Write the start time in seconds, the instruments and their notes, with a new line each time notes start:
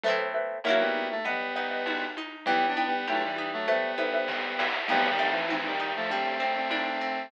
0.04 orchestral harp A3 B3, xylophone A4 B4 C5 E5, low conga
0.08 orchestral harp C4 E4
0.34 xylophone A4 B4 C5 E5
0.64 lead 1 (square) F#3 A#3, orchestral harp A#3 C#4, xylophone A#4 C#5 E5 F#5, tambourine, high conga
0.69 orchestral harp E4 F#4
0.80 lead 1 (square) G3 B3
0.94 high conga
1.11 lead 1 (square) A3
1.25 lead 1 (square) G3 B3, orchestral harp B3, xylophone B4 D#5 F#5, low conga
1.56 orchestral harp D#4, xylophone B4 D#5 F#5, snare
1.71 xylophone B4 D#5 F#5
1.86 orchestral harp F#4, tambourine, high conga
2.17 orchestral harp D#4, high conga
2.46 orchestral harp E3, lead 1 (square) G3 B3, xylophone E4 B4 G5, low conga
2.67 lead 1 (square) B3 D4
2.76 orchestral harp B3, xylophone E4 B4 G5, high conga
2.86 lead 1 (square) G3 B3
3.07 lead 1 (square) F#3 A3, xylophone E4 B4 G5, orchestral harp G4, tambourine, high conga
3.24 lead 1 (square) E3 G3
3.36 orchestral harp B3, high conga
3.53 lead 1 (square) F#3 A3
3.68 lead 1 (square) G3 B3, orchestral harp A3, xylophone A4 B4 C5 E5, low conga
3.98 orchestral harp B3, xylophone A4 B4 C5 E5, snare, high conga
4.13 xylophone A4 B4 C5 E5
4.28 orchestral harp C4, kick, snare
4.59 orchestral harp E4, snare
4.88 xylophone F3 A3 C4 D#4, orchestral harp F3, lead 1 (square) G3 B3, crash, low conga
5.09 lead 1 (square) D#3 G3
5.19 xylophone F3 A3 C4 D#4, orchestral harp A3
5.30 lead 1 (square) E3
5.49 lead 1 (square) E3, xylophone F3 A3 C4 D#4, orchestral harp C4, tambourine, high conga
5.66 lead 1 (square) D#3 G3
5.80 orchestral harp D#4
5.96 lead 1 (square) F3 A3
6.10 xylophone G3 C4 D4, orchestral harp G3, lead 1 (square) A3 C4, low conga
6.40 xylophone G3 C4 D4, orchestral harp C4, snare
6.56 xylophone G3 C4 D4
6.70 orchestral harp D4, tambourine, high conga
7.01 orchestral harp C4